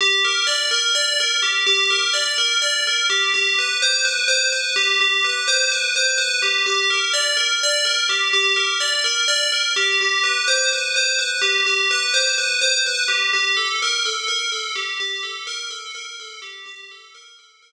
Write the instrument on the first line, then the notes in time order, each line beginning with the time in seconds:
tubular bells
0.01 G4
0.25 A#4
0.47 D5
0.71 A#4
0.95 D5
1.20 A#4
1.42 G4
1.67 G4
1.90 A#4
2.13 D5
2.38 A#4
2.62 D5
2.87 A#4
3.10 G4
3.34 G4
3.59 B4
3.82 C5
4.05 B4
4.28 C5
4.52 B4
4.76 G4
5.01 G4
5.24 B4
5.48 C5
5.72 B4
5.96 C5
6.18 B4
6.42 G4
6.66 G4
6.90 A#4
7.13 D5
7.37 A#4
7.63 D5
7.85 A#4
8.09 G4
8.33 G4
8.56 A#4
8.80 D5
9.04 A#4
9.28 D5
9.52 A#4
9.76 G4
10.01 G4
10.24 B4
10.48 C5
10.73 B4
10.96 C5
11.19 B4
11.42 G4
11.66 G4
11.91 B4
12.14 C5
12.38 B4
12.61 C5
12.86 B4
13.08 G4
13.33 G4
13.57 A4
13.82 A#4
14.05 A4
14.28 A#4
14.52 A4
14.75 G4
15.00 G4
15.23 A4
15.47 A#4
15.70 A4
15.95 A#4
16.20 A4
16.42 G4
16.66 G4
16.91 A4
17.15 A#4
17.39 A4
17.62 A#4